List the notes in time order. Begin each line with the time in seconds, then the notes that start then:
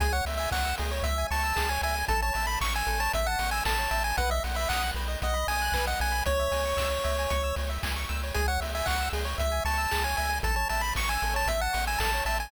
0.00 C#2 G#4 G#5, kick, closed hi-hat
0.12 C#5 F#5
0.25 C#2 E5, open hi-hat
0.37 E5 G#5
0.51 C#2 F#5 C#6, kick, clap
0.64 E6
0.78 C#2 G#4, open hi-hat
0.91 C#5
1.03 C#2 E5, kick, closed hi-hat
1.18 G#5
1.30 C#2 A5 C#6, open hi-hat
1.43 E6
1.56 C#2 G#4, kick, clap
1.69 C#5 G#5
1.82 C#2 E5 G#5, open hi-hat
1.95 G#5
2.08 A1 A4 A5, kick, closed hi-hat
2.22 C#5 A5
2.34 A1 E5 A5, open hi-hat
2.47 A5 B5
2.61 A1 C#6, kick, clap
2.74 G#5 E6
2.87 A1 A4, open hi-hat
3.00 C#5 A5
3.13 A1 E5, kick, closed hi-hat
3.27 F#5 A5
3.39 A1 C#6, open hi-hat
3.51 G#5 E6
3.65 A1 A4 A5, kick, clap
3.78 C#5
3.91 A1 E5 A5, open hi-hat
4.04 G#5 A5
4.17 B1 B4 F#5, kick, closed hi-hat
4.30 D#5 E5
4.44 B1 F#5, open hi-hat
4.55 E5 B5
4.69 B1 F#5 D#6, kick, clap
4.82 F#6
4.94 B1 B4, open hi-hat
5.08 D#5
5.22 B1 D#5 F#5, kick, closed hi-hat
5.34 B5
5.47 B1 G#5 D#6, open hi-hat
5.62 F#6
5.72 B1 B4, kick, clap
5.87 D#5 F#5
6.00 B1 F#5 G#5, open hi-hat
6.12 B5
6.26 C#2 C#5, kick, closed hi-hat
6.39 E5
6.51 C#2 G#5, open hi-hat
6.65 C#6
6.77 C#2 E6, kick, clap
6.91 C#5
7.04 C#2 E5, open hi-hat
7.18 G#5
7.30 C#2 C#6, kick, closed hi-hat
7.43 E6
7.56 C#2 C#5, open hi-hat
7.69 E5
7.83 C#2 G#5, kick, clap
7.96 C#6
8.09 C#2 E6, open hi-hat
8.23 C#5
8.34 C#2 G#4 G#5, kick, closed hi-hat
8.48 C#5 F#5
8.60 C#2 E5, open hi-hat
8.74 E5 G#5
8.86 C#2 F#5 C#6, kick, clap
9.01 E6
9.13 C#2 G#4, open hi-hat
9.25 C#5
9.38 C#2 E5, kick, closed hi-hat
9.51 G#5
9.65 C#2 A5 C#6, open hi-hat
9.78 E6
9.91 C#2 G#4, kick, clap
10.04 C#5 G#5
10.17 C#2 E5 G#5, open hi-hat
10.29 G#5
10.43 A1 A4 A5, kick, closed hi-hat
10.56 C#5 A5
10.69 A1 E5 A5, open hi-hat
10.81 A5 B5
10.95 A1 C#6, kick, clap
11.09 G#5 E6
11.22 A1 A4, open hi-hat
11.34 C#5 A5
11.46 A1 E5, kick, closed hi-hat
11.61 F#5 A5
11.73 A1 C#6, open hi-hat
11.87 G#5 E6
11.98 A1 A4 A5, kick, clap
12.13 C#5
12.25 A1 E5 A5, open hi-hat
12.40 G#5 A5